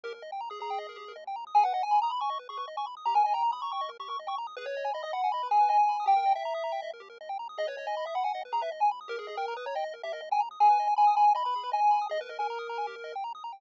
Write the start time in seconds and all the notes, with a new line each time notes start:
0.04 D#2 G4 A#4
0.14 A#4
0.22 D#2 D#5
0.32 G5
0.41 D#2 A#5
0.50 G#4 D#6
0.60 D#2 G#4 A#5
0.70 G5
0.78 D#2 D#5
0.89 A#4
0.96 D#2 G4
1.08 A#4
1.16 D#2 D#5
1.27 G5
1.36 D#2 A#5
1.47 D#6
1.55 G#1 G#4 G#5
1.64 B4 F#5
1.73 G#1 D#5 F#5
1.83 G#5
1.91 G#1 B5
2.02 A#5 D#6
2.10 G#1 B5
2.21 G#5 C#6
2.30 G#1 D#5
2.39 B4
2.49 G#1 G#4 C#6
2.57 B4 C#6
2.68 G#1 D#5
2.77 G#5 C#6
2.86 G#1 B5
2.97 D#6
3.06 D#2 G4 A#5
3.14 A#4 G#5
3.24 D#2 D#5 G#5
3.34 G5 A#5
3.43 D#2 A#5
3.52 B5 D#6
3.62 D#2 A#5 C#6
3.72 G5 C#6
3.81 D#2 D#5
3.89 A#4
3.99 D#2 G4 C#6
4.08 A#4 C#6
4.19 D#2 D#5
4.27 G5 C#6
4.37 D#2 A#5
4.47 D#6
4.56 G#1 G#4 B4
4.66 B4 C#5
4.75 G#1 D#5
4.84 G#5
4.93 G#1 D#5 B5
5.03 D#5 D#6
5.13 G#1 F#5 B5
5.24 G#5
5.32 G#1 D#5 B5
5.43 B4
5.51 G#1 G#4 G#5
5.61 B4
5.69 G#1 D#5 G#5
5.78 G#5
5.88 G#1 B5
6.00 D#6
6.06 D#2 G4 G5
6.16 A#4
6.26 D#2 D#5
6.35 E5 G5
6.45 D#2 A#5
6.54 D#6
6.64 D#2 A#5
6.72 G5
6.82 D#2 D#5
6.93 A#4
7.00 D#2 G4
7.10 A#4
7.21 D#2 D#5
7.29 G5
7.39 D#2 A#5
7.49 D#6
7.58 D#2 G#4 D#5
7.67 B4 C#5
7.77 D#2 C#5 D#5
7.87 D#5 G#5
7.96 D#2 B5
8.06 E5 D#6
8.15 D#2 F#5 B5
8.24 F#5 G#5
8.33 D#2 D#5
8.45 B4
8.52 D#2 G#4 A#5
8.61 B4 E5
8.72 D#2 D#5
8.80 G#5
8.91 D#2 B5
9.01 D#6
9.08 D#2 G4 A#4
9.19 G#4 A#4
9.27 D#2 G#4 D#5
9.37 A#4 G5
9.47 D#2 A#5
9.57 B4 D#6
9.66 D#2 C#5 A#5
9.75 D#5 G5
9.84 D#2 D#5
9.94 A#4
10.03 D#2 G4 E5
10.13 A#4 D#5
10.21 D#2 D#5
10.31 G5 G#5
10.40 D#2 A#5
10.51 D#6
10.60 G#1 G#4 G#5
10.70 B4
10.79 G#1 D#5
10.87 G#5
10.96 G#1 G#5 B5
11.07 D#6
11.17 G#1 G#5 B5
11.28 G#5
11.35 G#1 D#5 B5
11.45 B4 B5
11.55 G#1 G#4
11.63 B4
11.72 G#1 D#5 G#5
11.82 G#5
11.91 G#1 B5
12.01 D#6
12.09 D#2 G#4 D#5
12.21 A#4 B4
12.29 D#2 A#4 D#5
12.39 A#4 G#5
12.49 D#2 A#5
12.59 D#6
12.68 D#2 A#5
12.78 G#5
12.86 D#2 G4
12.96 A#4
13.04 D#2 D#5
13.15 G5
13.24 D#2 A#5
13.35 D#6
13.44 D#2 A#5
13.53 G5